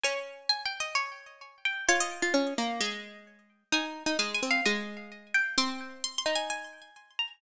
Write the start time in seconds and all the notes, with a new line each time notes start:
0.04 C#4 G#5
0.49 G#5
0.66 G5
0.80 D#5
0.95 C#5
1.65 G5
1.89 F4 C#5
2.00 D#5
2.22 F4
2.34 C#4
2.58 A#3
2.81 G#3
3.72 D#4 G#5
4.06 D#4
4.19 G#3 G#5
4.35 G#5
4.43 C4
4.51 F5
4.66 G#3 D#5
5.34 G5
5.58 C4 C6
6.04 C6
6.18 C6
6.26 D#4
6.35 G#5
6.50 G#5
7.19 A#5